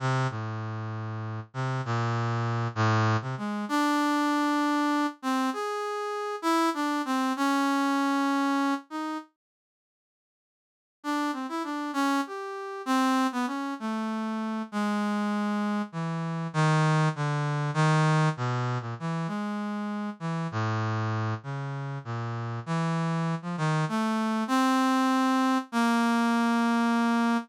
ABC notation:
X:1
M:6/8
L:1/16
Q:3/8=65
K:none
V:1 name="Brass Section"
C,2 A,,8 C,2 | ^A,,6 =A,,3 C, ^G,2 | D10 C2 | ^G6 E2 D2 C2 |
^C10 ^D2 | z12 | D2 C E D2 ^C2 G4 | C3 B, ^C2 A,6 |
^G,8 E,4 | ^D,4 =D,4 ^D,4 | B,,3 ^A,, E,2 ^G,6 | E,2 A,,6 ^C,4 |
^A,,4 E,5 F, ^D,2 | A,4 C8 | ^A,12 |]